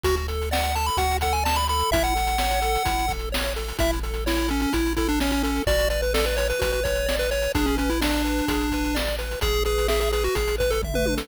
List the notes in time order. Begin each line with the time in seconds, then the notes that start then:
0.04 D2 F#4, kick, closed hi-hat
0.16 closed hi-hat
0.28 A4, closed hi-hat
0.42 closed hi-hat
0.51 D5 F#5, snare
0.63 closed hi-hat
0.75 A4 A5, closed hi-hat
0.86 B5, closed hi-hat
0.97 D2 F#4 F#5, kick, closed hi-hat
1.11 closed hi-hat
1.21 A4 F#5, kick, closed hi-hat
1.33 G#5, closed hi-hat
1.44 D5 A5, snare
1.55 B5, closed hi-hat
1.68 A4 B5, closed hi-hat
1.79 closed hi-hat
1.91 A1 E4 E5, kick, closed hi-hat
2.04 F#5, closed hi-hat
2.16 A4, closed hi-hat
2.27 closed hi-hat
2.38 C#5, snare
2.51 closed hi-hat
2.62 A4, closed hi-hat
2.75 closed hi-hat
2.85 A1 E4, kick, closed hi-hat
2.99 closed hi-hat
3.08 A4, kick, closed hi-hat
3.19 closed hi-hat
3.32 C#5, snare
3.44 closed hi-hat
3.56 A4, closed hi-hat
3.68 closed hi-hat
3.79 A1 E4 E5, kick, closed hi-hat
3.93 closed hi-hat
4.03 A4, closed hi-hat
4.14 closed hi-hat
4.26 E4 C#5, snare
4.37 closed hi-hat
4.48 C#4 A4, closed hi-hat
4.60 C#4, closed hi-hat
4.73 A1 E4, kick, closed hi-hat
4.86 closed hi-hat
4.96 E4 A4, kick, closed hi-hat
5.08 D4, closed hi-hat
5.20 C#4 C#5, snare
5.31 C#4, closed hi-hat
5.43 C#4 A4, closed hi-hat
5.56 closed hi-hat
5.67 A1 F#4 D5, kick, closed hi-hat
5.79 closed hi-hat
5.90 B4 D5, closed hi-hat
6.02 B4, closed hi-hat
6.14 A4 D5, snare
6.25 B4, closed hi-hat
6.37 B4 C#5, closed hi-hat
6.50 B4, closed hi-hat
6.59 A1 F#4 B4, kick, closed hi-hat
6.72 B4, closed hi-hat
6.84 B4 C#5, kick, closed hi-hat
6.95 closed hi-hat
7.06 D5, snare
7.19 B4, closed hi-hat
7.31 B4 C#5, closed hi-hat
7.42 closed hi-hat
7.54 A1 D4 G#4, kick, closed hi-hat
7.66 C#4, closed hi-hat
7.77 C#4 B4, closed hi-hat
7.89 E4, closed hi-hat
8.01 D4 D5, snare
8.14 closed hi-hat
8.25 B4, closed hi-hat
8.38 closed hi-hat
8.48 A1 G#4, kick, closed hi-hat
8.61 closed hi-hat
8.71 B4, kick, closed hi-hat
8.84 closed hi-hat
8.95 D5, snare
9.07 closed hi-hat
9.18 B4, closed hi-hat
9.31 closed hi-hat
9.41 A1 G#4, kick, closed hi-hat
9.53 closed hi-hat
9.65 G#4 B4, closed hi-hat
9.78 closed hi-hat
9.88 G#4 E5, snare
10.00 G#4, closed hi-hat
10.12 G#4 B4, closed hi-hat
10.24 F#4, closed hi-hat
10.35 A1 G#4, kick, closed hi-hat
10.48 closed hi-hat
10.58 B4, kick, closed hi-hat
10.71 A4, closed hi-hat
10.83 E5, kick, floor tom
10.94 B4, mid tom
11.06 B4, high tom
11.17 A4, snare